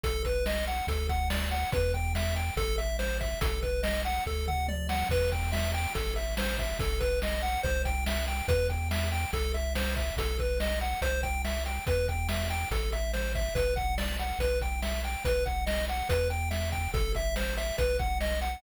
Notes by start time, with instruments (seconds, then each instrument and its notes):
0.03 synth bass 1 B1, lead 1 (square) A4, kick, closed hi-hat
0.25 lead 1 (square) B4, kick, closed hi-hat
0.46 lead 1 (square) D#5, snare
0.67 lead 1 (square) F#5, closed hi-hat
0.87 synth bass 1 D2, lead 1 (square) A4, kick, closed hi-hat
1.09 lead 1 (square) F#5, kick, closed hi-hat
1.30 lead 1 (square) D5, snare
1.51 lead 1 (square) F#5, closed hi-hat
1.72 synth bass 1 E2, lead 1 (square) B4, kick, closed hi-hat
1.94 lead 1 (square) G5, kick, closed hi-hat
2.15 lead 1 (square) E5, snare
2.36 lead 1 (square) G5, closed hi-hat
2.57 synth bass 1 A1, lead 1 (square) A4, kick, closed hi-hat
2.78 lead 1 (square) E5, closed hi-hat
2.99 lead 1 (square) C5, snare
3.21 lead 1 (square) E5, kick, closed hi-hat
3.41 synth bass 1 B1, lead 1 (square) A4, kick, closed hi-hat
3.62 lead 1 (square) B4, kick, closed hi-hat
3.83 lead 1 (square) D#5, snare
4.05 lead 1 (square) F#5, closed hi-hat
4.26 synth bass 1 D2, lead 1 (square) A4, kick
4.47 lead 1 (square) F#5, mid tom
4.68 lead 1 (square) D5, high tom
4.89 lead 1 (square) F#5, snare
5.09 synth bass 1 E2, lead 1 (square) B4, kick, crash
5.32 lead 1 (square) G5, kick, closed hi-hat
5.52 lead 1 (square) E5, snare
5.74 lead 1 (square) G5, closed hi-hat
5.95 synth bass 1 A1, lead 1 (square) A4, kick, closed hi-hat
6.16 lead 1 (square) E5, closed hi-hat
6.37 lead 1 (square) C5, snare
6.58 lead 1 (square) E5, kick, closed hi-hat
6.79 synth bass 1 B1, lead 1 (square) A4, kick, closed hi-hat
7.00 lead 1 (square) B4, kick, closed hi-hat
7.22 lead 1 (square) D#5, snare
7.42 lead 1 (square) F#5, closed hi-hat
7.63 synth bass 1 C2, lead 1 (square) C5, kick, closed hi-hat
7.85 lead 1 (square) G5, kick, closed hi-hat
8.06 lead 1 (square) E5, snare
8.28 lead 1 (square) G5, closed hi-hat
8.48 synth bass 1 E2, lead 1 (square) B4, kick, closed hi-hat
8.69 lead 1 (square) G5, kick, closed hi-hat
8.91 lead 1 (square) E5, snare
9.12 lead 1 (square) G5, closed hi-hat
9.33 synth bass 1 C2, lead 1 (square) A4, kick, closed hi-hat
9.54 lead 1 (square) E5, closed hi-hat
9.75 lead 1 (square) C5, snare
9.96 lead 1 (square) E5, kick, closed hi-hat
10.17 synth bass 1 B1, lead 1 (square) A4, kick, closed hi-hat
10.39 lead 1 (square) B4, kick, closed hi-hat
10.60 lead 1 (square) D#5, snare
10.81 lead 1 (square) F#5, closed hi-hat
11.01 synth bass 1 C2, lead 1 (square) C5, kick, closed hi-hat
11.23 lead 1 (square) G5, kick, closed hi-hat
11.45 lead 1 (square) E5, snare
11.66 lead 1 (square) G5, closed hi-hat
11.86 synth bass 1 E2, lead 1 (square) B4, kick, closed hi-hat
12.08 lead 1 (square) G5, kick, closed hi-hat
12.29 lead 1 (square) E5, snare
12.50 lead 1 (square) G5, closed hi-hat
12.71 synth bass 1 A1, lead 1 (square) A4, kick, closed hi-hat
12.92 lead 1 (square) E5, closed hi-hat
13.13 lead 1 (square) C5, snare
13.35 lead 1 (square) E5, kick, closed hi-hat
13.55 synth bass 1 B1, lead 1 (square) B4, kick, closed hi-hat
13.76 lead 1 (square) F#5, kick, closed hi-hat
13.98 lead 1 (square) D5, snare
14.19 lead 1 (square) F#5, closed hi-hat
14.39 synth bass 1 B1, lead 1 (square) B4, kick, closed hi-hat
14.61 lead 1 (square) G5, kick, closed hi-hat
14.82 lead 1 (square) E5, snare
15.04 lead 1 (square) G5, closed hi-hat
15.25 synth bass 1 B1, lead 1 (square) B4, kick, closed hi-hat
15.46 lead 1 (square) F#5, kick, closed hi-hat
15.66 lead 1 (square) D#5, snare
15.88 lead 1 (square) F#5, closed hi-hat
16.09 synth bass 1 E2, lead 1 (square) B4, kick, closed hi-hat
16.30 lead 1 (square) G5, closed hi-hat
16.51 lead 1 (square) E5, snare
16.72 lead 1 (square) G5, kick, closed hi-hat
16.94 synth bass 1 A1, lead 1 (square) A4, kick, closed hi-hat
17.15 lead 1 (square) E5, kick, closed hi-hat
17.36 lead 1 (square) C5, snare
17.57 lead 1 (square) E5, closed hi-hat
17.78 synth bass 1 B1, lead 1 (square) B4, kick, closed hi-hat
17.99 lead 1 (square) F#5, kick, closed hi-hat
18.21 lead 1 (square) D#5, snare
18.41 lead 1 (square) F#5, closed hi-hat